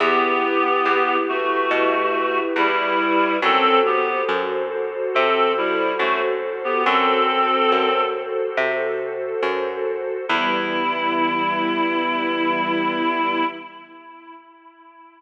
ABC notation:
X:1
M:4/4
L:1/16
Q:1/4=70
K:Em
V:1 name="Clarinet"
[B,G]6 [A,F]6 [G,E]4 | [CA]2 [B,G]2 z4 [CA]2 [G,E]2 [A,F] z2 [B,G] | [CA]6 z10 | E16 |]
V:2 name="String Ensemble 1"
[EGB]16 | [FAc]16 | [FAc]16 | [E,G,B,]16 |]
V:3 name="Electric Bass (finger)" clef=bass
E,,4 E,,4 B,,4 E,,4 | F,,4 F,,4 C,4 F,,4 | F,,4 F,,4 C,4 F,,4 | E,,16 |]